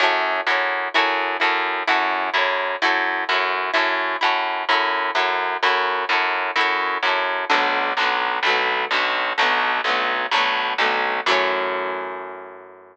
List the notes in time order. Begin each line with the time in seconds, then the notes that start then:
0.00 F#2 E4 F#4 A4
0.05 C#5
0.47 F#2 E4 F#4 A4
0.52 C#5
0.94 F#2 E4 F#4 A4
0.99 C#5
1.40 F#2 E4 F#4 A4
1.45 C#5
1.87 F#2 E4 F#4 A4
1.92 C#5
2.34 F#2 E4 F#4 A4
2.38 C#5
2.82 F#2 E4 F#4 A4
2.87 C#5
3.29 F#2 E4 F#4 A4
3.34 C#5
3.74 F#2 E4 F#4 A4
3.78 C#5
4.21 F#2 E4 F#4 A4
4.26 C#5
4.69 F#2 E4 F#4 A4
4.74 C#5
5.15 F#2 E4 F#4 A4
5.20 C#5
5.63 F#2 E4 F#4 A4
5.68 C#5
6.09 F#2 E4 F#4 A4
6.14 C#5
6.56 F#2 E4 F#4 A4
6.61 C#5
7.03 F#2 E4 F#4
7.07 A4 C#5
7.50 B1 D3 F#3 A3
7.54 B3
7.97 B1 D3 F#3
8.01 A3 B3
8.43 B1 D3 F#3
8.48 A3 B3
8.91 B1 D3 F#3 A3
8.96 B3
9.38 B1 D3 F#3 A3
9.42 B3
9.84 B1 D3 F#3 A3
9.89 B3
10.31 B1 D3 F#3
10.36 A3 B3
10.78 B1 D3 F#3 A3
10.83 B3
11.26 F#2 E3 F#3 A3
11.31 C#4